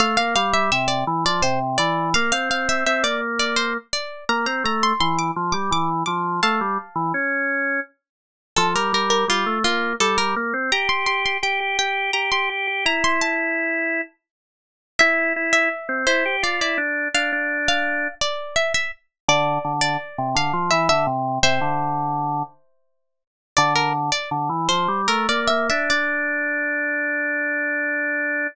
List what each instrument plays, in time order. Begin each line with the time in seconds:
0.00 drawbar organ A3, pizzicato strings F5
0.17 drawbar organ A#3, pizzicato strings F5
0.36 drawbar organ G3, pizzicato strings F5
0.54 pizzicato strings E5
0.72 drawbar organ C3, pizzicato strings E5
0.88 pizzicato strings D5
1.07 drawbar organ E3
1.25 drawbar organ F3, pizzicato strings D5
1.42 drawbar organ C3, pizzicato strings C5
1.78 drawbar organ E3, pizzicato strings D5
2.14 drawbar organ A#3, pizzicato strings F5
2.32 drawbar organ C4, pizzicato strings F5
2.50 drawbar organ C4, pizzicato strings F5
2.69 pizzicato strings E5
2.86 drawbar organ C4, pizzicato strings E5
3.03 drawbar organ A#3, pizzicato strings D5
3.39 pizzicato strings D5
3.56 pizzicato strings C5
3.93 pizzicato strings D5
4.29 drawbar organ A#3, pizzicato strings A#5
4.46 drawbar organ C4, pizzicato strings A#5
4.64 drawbar organ A3, pizzicato strings A#5
4.83 pizzicato strings C6
5.00 drawbar organ E3, pizzicato strings C6
5.19 pizzicato strings D6
5.36 drawbar organ F3
5.52 drawbar organ G3, pizzicato strings D6
5.71 drawbar organ E3, pizzicato strings D6
6.06 drawbar organ F3, pizzicato strings D6
6.43 drawbar organ A3, pizzicato strings F5 A5
6.61 drawbar organ G3
6.96 drawbar organ E3
7.14 drawbar organ C#4
8.56 drawbar organ F3, pizzicato strings A4
8.75 drawbar organ G3, pizzicato strings A#4
8.93 drawbar organ G3, pizzicato strings A#4
9.10 pizzicato strings A#4
9.28 drawbar organ G3, pizzicato strings F4
9.46 drawbar organ A3
9.64 drawbar organ A#3, pizzicato strings F4
10.00 drawbar organ G3, pizzicato strings A4
10.18 drawbar organ G3, pizzicato strings A#4
10.36 drawbar organ A#3
10.54 drawbar organ C4
10.72 drawbar organ G4, pizzicato strings A#5
10.89 drawbar organ G4, pizzicato strings C6
11.06 drawbar organ G4, pizzicato strings C6
11.26 pizzicato strings C6
11.43 drawbar organ G4, pizzicato strings G5
11.60 drawbar organ G4
11.79 drawbar organ G4, pizzicato strings G5
12.13 drawbar organ G4, pizzicato strings A#5
12.32 drawbar organ G4, pizzicato strings C6
12.50 drawbar organ G4
12.67 drawbar organ G4
12.85 drawbar organ E4, pizzicato strings A#5
13.04 pizzicato strings C6
13.21 pizzicato strings A5
14.99 drawbar organ E4, pizzicato strings E5
15.36 drawbar organ E4
15.53 pizzicato strings E5
15.89 drawbar organ C4
16.07 drawbar organ E4, pizzicato strings C5
16.25 drawbar organ G4
16.43 drawbar organ F4, pizzicato strings D5
16.61 drawbar organ E4, pizzicato strings D5
16.78 drawbar organ D4
17.14 drawbar organ D4, pizzicato strings F5
17.32 drawbar organ D4
17.68 pizzicato strings F5
18.21 pizzicato strings D5
18.56 pizzicato strings E5
18.74 pizzicato strings E5
19.28 drawbar organ D3, pizzicato strings D5
19.65 drawbar organ D3
19.81 pizzicato strings D5
20.18 drawbar organ C3
20.35 drawbar organ D3, pizzicato strings F5
20.53 drawbar organ F3
20.71 drawbar organ E3, pizzicato strings E5
20.89 drawbar organ D3, pizzicato strings E5
21.07 drawbar organ C3
21.43 drawbar organ C3, pizzicato strings C5 E5
21.61 drawbar organ D3
23.57 drawbar organ D3, pizzicato strings D5
23.76 pizzicato strings A#4
24.12 pizzicato strings D5
24.31 drawbar organ D3
24.49 drawbar organ E3
24.69 drawbar organ F3, pizzicato strings C5
24.88 drawbar organ G3
25.08 drawbar organ A3, pizzicato strings A#4
25.29 drawbar organ A#3, pizzicato strings D5
25.48 drawbar organ A#3, pizzicato strings E5
25.70 drawbar organ D4, pizzicato strings E5
25.90 drawbar organ D4, pizzicato strings D5